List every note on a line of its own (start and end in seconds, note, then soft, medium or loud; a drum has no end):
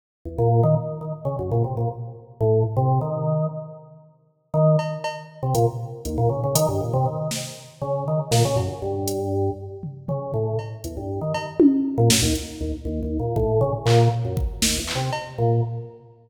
0.25 0.37 E2 medium
0.38 0.61 A#2 loud
0.63 0.75 D#3 loud
1.01 1.12 D#3 medium
1.25 1.36 C#3 medium
1.39 1.50 F#2 medium
1.51 1.63 A#2 loud
1.64 1.76 C3 medium
1.77 1.88 A#2 medium
2.41 2.63 A2 loud
2.77 2.99 C3 loud
3.01 3.47 D#3 medium
4.54 4.76 D#3 loud
4.79 cowbell medium
5.04 cowbell medium
5.43 5.54 C3 medium
5.55 5.66 A#2 loud
5.55 closed hi-hat medium
6.05 6.17 D#2 medium
6.05 closed hi-hat medium
6.18 6.29 A#2 loud
6.29 6.41 C#3 medium
6.44 6.55 C#3 medium
6.55 6.66 D#3 loud
6.55 closed hi-hat loud
6.68 6.80 G2 medium
6.81 6.92 A#2 medium
6.93 7.05 C3 loud
7.06 7.28 D#3 medium
7.31 snare medium
7.82 8.04 C#3 medium
8.08 8.19 D#3 medium
8.31 8.43 A#2 loud
8.31 snare medium
8.45 8.56 C#3 loud
8.56 8.67 F#2 medium
8.56 cowbell soft
8.82 9.50 G2 medium
9.08 closed hi-hat medium
9.83 floor tom medium
10.08 10.32 C#3 medium
10.08 floor tom medium
10.34 10.56 A2 medium
10.59 cowbell medium
10.84 10.96 E2 medium
10.84 closed hi-hat medium
10.97 11.20 G2 medium
11.21 11.33 D#3 medium
11.34 11.46 D#3 medium
11.34 cowbell medium
11.60 high tom loud
11.98 12.09 A#2 loud
12.10 12.22 F#2 medium
12.10 snare loud
12.22 12.33 D#2 loud
12.35 closed hi-hat medium
12.61 12.72 D#2 medium
12.85 13.00 D#2 medium
13.03 13.18 D#2 medium
13.19 13.35 A#2 medium
13.36 13.59 A2 loud
13.36 kick medium
13.61 13.72 C#3 loud
13.86 14.08 A#2 loud
13.86 clap medium
14.25 14.36 F#2 medium
14.37 kick medium
14.62 14.78 D#2 medium
14.62 snare medium
14.78 14.93 E2 medium
14.87 clap medium
14.95 15.10 C3 medium
15.13 cowbell medium
15.38 15.61 A#2 medium